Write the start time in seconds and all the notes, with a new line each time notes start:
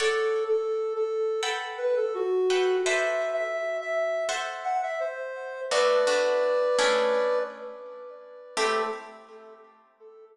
0.00 A4 C#5 D5 F#5
0.48 A4
0.95 A4
1.43 A4 B4 F#5 G5
1.78 B4
1.97 A4
2.14 F#4
2.50 A4 B4 F#5 G5
2.85 A4 B4 C5 D5 E5
3.33 E5
3.81 E5
4.29 A4 C5 E5 F#5
4.64 F#5
4.83 E5
5.00 C5
5.71 A3 B3 D4 F#4 B4 D5
6.07 A3 B3 D4 F#4
6.79 A3 C#4 D4 E4 G#4
8.57 A3 C4 E4 G4 A4